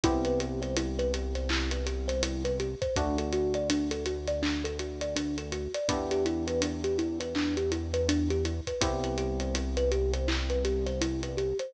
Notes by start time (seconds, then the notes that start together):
0.04 C2 B3 C4 E4 G4, kick, closed hi-hat
0.25 B4, closed hi-hat
0.40 G4, closed hi-hat
0.62 C5, snare, closed hi-hat
0.77 E4, closed hi-hat
0.99 B4, closed hi-hat
1.14 G4, closed hi-hat
1.35 C5, snare, closed hi-hat
1.49 E4, clap
1.71 B4, closed hi-hat
1.86 G4, closed hi-hat
2.08 C5, snare, closed hi-hat
2.23 E4, closed hi-hat
2.45 B4, closed hi-hat
2.60 G4, closed hi-hat
2.82 C5, kick, closed hi-hat
2.96 D2 A3 D4 F#4, kick, closed hi-hat
3.18 A4, closed hi-hat
3.32 F#4, closed hi-hat
3.54 D5, closed hi-hat
3.70 D4, closed hi-hat
3.91 A4, closed hi-hat
4.06 F#4, closed hi-hat
4.27 D5, snare, closed hi-hat
4.43 D4, clap
4.64 A4, closed hi-hat
4.79 F#4, closed hi-hat
5.01 D5, closed hi-hat
5.16 D4, closed hi-hat
5.38 A4, closed hi-hat
5.52 F#4, closed hi-hat
5.74 D5, closed hi-hat
5.89 E2 B3 D4 E4 G4, kick, closed hi-hat
6.11 G4, closed hi-hat
6.25 E4, closed hi-hat
6.47 B4, closed hi-hat
6.62 D4, closed hi-hat
6.84 G4, closed hi-hat
6.98 E4, closed hi-hat
7.20 B4, closed hi-hat
7.35 D4, clap
7.57 G4, closed hi-hat
7.72 E4, closed hi-hat
7.94 B4, closed hi-hat
8.09 D4, closed hi-hat
8.30 G4, closed hi-hat
8.45 E4, closed hi-hat
8.67 B4, kick, closed hi-hat
8.81 C2 B3 C4 E4 G4, kick, closed hi-hat
9.04 B4, closed hi-hat
9.18 G4, closed hi-hat
9.40 C5, closed hi-hat
9.54 E4, closed hi-hat
9.77 B4, closed hi-hat
9.91 G4, closed hi-hat
10.13 C5, closed hi-hat
10.28 E4, clap
10.50 B4, closed hi-hat
10.65 G4, closed hi-hat
10.86 C5, snare, closed hi-hat
11.01 E4, closed hi-hat
11.23 B4, closed hi-hat
11.37 G4, closed hi-hat
11.59 C5, closed hi-hat